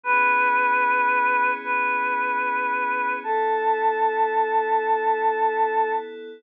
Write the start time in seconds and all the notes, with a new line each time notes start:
0.04 G#1 B3 C#4 E4 G#4 B4
1.64 B4
3.23 A1 B3 E4 A4